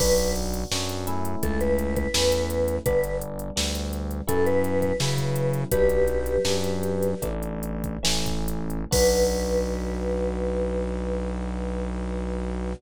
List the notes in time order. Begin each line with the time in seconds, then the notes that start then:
0.00 B1 B3 D4 F#4 B4, kick, crash
0.18 closed hi-hat
0.36 closed hi-hat
0.54 closed hi-hat
0.71 F#2 B3 D4 F#4, snare
0.89 closed hi-hat
1.07 A3 C#4 E4, closed hi-hat
1.25 closed hi-hat
1.43 C#2 A4, kick, closed hi-hat
1.61 B4, closed hi-hat
1.79 closed hi-hat
1.96 B4, kick, closed hi-hat
2.14 E2 A3 C#4 E4, snare
2.32 closed hi-hat
2.50 closed hi-hat
2.68 closed hi-hat
2.86 G1 G3 B3 D4 B4, kick, closed hi-hat
3.04 closed hi-hat
3.21 closed hi-hat
3.39 closed hi-hat
3.56 D2 G3 B3 D4, snare
3.75 closed hi-hat
3.93 closed hi-hat
4.11 closed hi-hat
4.27 F#2 F#3 B3 C#4 E4 A4, kick, closed hi-hat
4.46 B4, closed hi-hat
4.64 closed hi-hat
4.82 B4, kick, closed hi-hat
5.00 C#3 F#3 B3 C#4 E4, snare
5.18 kick, closed hi-hat
5.36 closed hi-hat
5.54 closed hi-hat
5.71 B1 F#3 B3 D4 G4 B4, kick, closed hi-hat
5.89 closed hi-hat
6.08 closed hi-hat
6.26 closed hi-hat
6.45 F#2 F#3 B3 D4, snare
6.64 closed hi-hat
6.83 closed hi-hat
7.03 closed hi-hat
7.22 A1 E3 A3 D4, kick, closed hi-hat
7.43 closed hi-hat
7.63 closed hi-hat
7.84 kick, closed hi-hat
8.03 A1 E3 A3 C#4, snare
8.26 kick, closed hi-hat
8.48 closed hi-hat
8.70 closed hi-hat
8.91 B1 B3 D4 F#4 B4, kick, crash